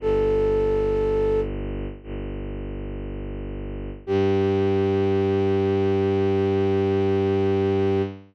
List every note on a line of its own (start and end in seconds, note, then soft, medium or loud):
0.00 1.86 G1 medium
0.00 1.40 A4 loud
2.03 3.90 G1 medium
4.07 8.02 G2 loud
4.07 8.02 G4 loud